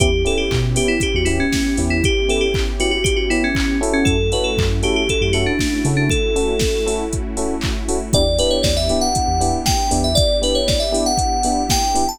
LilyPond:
<<
  \new Staff \with { instrumentName = "Electric Piano 2" } { \time 4/4 \key e \dorian \tempo 4 = 118 g'8 a'16 g'8 r16 g'16 e'16 g'16 fis'16 e'16 cis'8. r16 e'16 | g'8 a'16 g'8 r16 fis'16 fis'16 g'16 fis'16 e'16 cis'8. r16 cis'16 | a'8 b'16 a'8 r16 g'16 g'16 a'16 g'16 fis'16 d'8. r16 d'16 | a'2 r2 |
d''8 b'16 cis''16 d''16 e''8 fis''4~ fis''16 g''8. e''16 | d''8 b'16 cis''16 d''16 e''8 fis''4~ fis''16 g''8. a''16 | }
  \new Staff \with { instrumentName = "Electric Piano 1" } { \time 4/4 \key e \dorian <b cis' e' g'>8 <b cis' e' g'>4 <b cis' e' g'>4 <b cis' e' g'>4 <b cis' e' g'>8~ | <b cis' e' g'>8 <b cis' e' g'>4 <b cis' e' g'>4 <b cis' e' g'>4 <cis' e' fis' a'>8~ | <cis' e' fis' a'>8 <cis' e' fis' a'>4 <cis' e' fis' a'>4 <cis' e' fis' a'>4 <cis' e' fis' a'>8~ | <cis' e' fis' a'>8 <cis' e' fis' a'>4 <cis' e' fis' a'>4 <cis' e' fis' a'>4 <cis' e' fis' a'>8 |
<b d' e' g'>8 <b d' e' g'>4 <b d' e' g'>4 <b d' e' g'>4 <b d' e' g'>8~ | <b d' e' g'>8 <b d' e' g'>4 <b d' e' g'>4 <b d' e' g'>4 <b d' e' g'>8 | }
  \new Staff \with { instrumentName = "Synth Bass 2" } { \clef bass \time 4/4 \key e \dorian e,4 b,4~ b,16 e,4~ e,16 e,8~ | e,1 | fis,4 fis,4~ fis,16 fis,4~ fis,16 cis8~ | cis1 |
e,4 e,4~ e,16 e,4~ e,16 e,8~ | e,1 | }
  \new Staff \with { instrumentName = "Pad 5 (bowed)" } { \time 4/4 \key e \dorian <b cis' e' g'>1~ | <b cis' e' g'>1 | <a cis' e' fis'>1~ | <a cis' e' fis'>1 |
<b d' e' g'>1~ | <b d' e' g'>1 | }
  \new DrumStaff \with { instrumentName = "Drums" } \drummode { \time 4/4 <hh bd>8 hho8 <hc bd>8 hho8 <hh bd>8 hho8 <bd sn>8 hho8 | <hh bd>8 hho8 <hc bd>8 hho8 <hh bd>8 hho8 <hc bd>8 hho8 | <hh bd>8 hho8 <hc bd>8 hho8 <hh bd>8 hho8 <bd sn>8 hho8 | <hh bd>8 hho8 <bd sn>8 hho8 <hh bd>8 hho8 <hc bd>8 hho8 |
<hh bd>8 hho8 <bd sn>8 hho8 <hh bd>8 hho8 <bd sn>8 hho8 | <hh bd>8 hho8 <bd sn>8 hho8 <hh bd>8 hho8 <bd sn>8 hho8 | }
>>